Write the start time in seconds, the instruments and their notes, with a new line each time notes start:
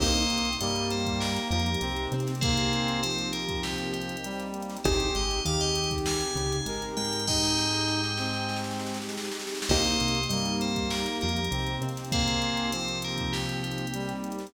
0.00 synth bass 1 C2, acoustic grand piano A#3 C4 D#4 G4, brass section A#3, pad 5 (bowed) A#3 C4 D#4 G4, tubular bells C5 D#5, kick, crash
0.16 closed hi-hat
0.30 synth bass 1 C2, acoustic grand piano C3, closed hi-hat
0.38 closed hi-hat
0.45 closed hi-hat
0.53 closed hi-hat
0.60 synth bass 1 G2, acoustic grand piano G3, brass section A#3, tubular bells D#5, closed hi-hat
0.76 closed hi-hat
0.90 tubular bells C5, closed hi-hat
1.06 kick, closed hi-hat
1.20 tubular bells A#4, snare
1.36 snare, closed hi-hat
1.51 synth bass 1 F2, acoustic grand piano F3, tubular bells A#4, closed hi-hat
1.59 closed hi-hat
1.66 closed hi-hat
1.74 closed hi-hat
1.81 synth bass 1 C2, acoustic grand piano C3, brass section C4, closed hi-hat
1.96 closed hi-hat
2.12 synth bass 1 C3, acoustic grand piano C4, closed hi-hat
2.20 closed hi-hat
2.27 snare, closed hi-hat
2.35 closed hi-hat
2.41 brass section A#3, tubular bells G#4 C5, kick, closed hi-hat
2.57 closed hi-hat
2.73 closed hi-hat
2.88 closed hi-hat
3.03 brass section F3, tubular bells C5, closed hi-hat
3.19 closed hi-hat
3.33 tubular bells A#4, closed hi-hat
3.48 kick, closed hi-hat
3.63 tubular bells G4, snare
3.78 closed hi-hat
3.93 tubular bells G4, closed hi-hat
4.02 closed hi-hat
4.09 closed hi-hat
4.17 closed hi-hat
4.24 brass section G3, closed hi-hat
4.40 snare, closed hi-hat
4.54 closed hi-hat
4.62 closed hi-hat
4.70 snare, closed hi-hat
4.77 closed hi-hat
4.84 synth bass 1 G#1, pad 5 (bowed) C4 D#4 G4 G#4, acoustic grand piano C4 D#4 G4 G#4, brass section G4, tubular bells C5, kick, closed hi-hat
5.00 closed hi-hat
5.15 synth bass 1 G#1, acoustic grand piano G#3, tubular bells D#5, closed hi-hat
5.30 snare, closed hi-hat
5.45 synth bass 1 D#2, acoustic grand piano D#3, brass section G4, tubular bells F5, closed hi-hat
5.60 tubular bells D#5, closed hi-hat
5.75 closed hi-hat
5.84 closed hi-hat
5.91 kick, closed hi-hat
5.98 closed hi-hat
6.06 tubular bells G#5, snare
6.21 closed hi-hat
6.36 synth bass 1 C#2, acoustic grand piano C#3, closed hi-hat
6.52 closed hi-hat
6.66 synth bass 1 G#1, acoustic grand piano G#3, brass section A#4, closed hi-hat
6.82 closed hi-hat
6.97 synth bass 1 G#2, acoustic grand piano G#3, tubular bells G5, closed hi-hat
7.05 closed hi-hat
7.13 snare, closed hi-hat
7.20 closed hi-hat
7.27 brass section D#4, tubular bells D#5 G5, kick, snare
7.43 snare
7.58 snare
7.72 snare
7.88 snare
8.03 snare
8.17 brass section C4, snare
8.33 snare
8.49 snare
8.56 snare
8.64 snare
8.71 snare
8.80 snare
8.86 snare
8.94 snare
9.02 snare
9.09 snare
9.18 snare
9.24 snare
9.31 snare
9.40 snare
9.47 snare
9.55 snare
9.62 snare
9.69 synth bass 1 C2, pad 5 (bowed) A#3 C4 D#4 G4, brass section A#3, acoustic grand piano A#3 C4 D#4 G4, tubular bells C5 D#5, kick, crash
9.85 closed hi-hat
10.00 synth bass 1 C2, acoustic grand piano C3, closed hi-hat
10.08 closed hi-hat
10.15 closed hi-hat
10.23 closed hi-hat
10.29 synth bass 1 G2, acoustic grand piano G3, brass section A#3, tubular bells D#5, closed hi-hat
10.45 closed hi-hat
10.61 tubular bells C5, closed hi-hat
10.76 kick, closed hi-hat
10.90 tubular bells A#4, snare
11.06 snare, closed hi-hat
11.21 synth bass 1 F2, acoustic grand piano F3, tubular bells A#4, closed hi-hat
11.29 closed hi-hat
11.36 closed hi-hat
11.44 closed hi-hat
11.51 synth bass 1 C2, acoustic grand piano C3, brass section C4, closed hi-hat
11.67 closed hi-hat
11.81 synth bass 1 C3, acoustic grand piano C4, closed hi-hat
11.89 closed hi-hat
11.97 snare, closed hi-hat
12.05 closed hi-hat
12.12 brass section A#3, tubular bells G#4 C5, kick, closed hi-hat
12.28 closed hi-hat
12.42 closed hi-hat
12.57 closed hi-hat
12.72 brass section F3, tubular bells C5, closed hi-hat
12.88 closed hi-hat
13.02 tubular bells A#4, closed hi-hat
13.18 kick, closed hi-hat
13.33 tubular bells G4, snare
13.49 closed hi-hat
13.63 tubular bells G4, closed hi-hat
13.71 closed hi-hat
13.78 closed hi-hat
13.87 closed hi-hat
13.94 brass section G3, closed hi-hat
14.09 snare, closed hi-hat
14.24 closed hi-hat
14.32 closed hi-hat
14.39 snare, closed hi-hat
14.47 closed hi-hat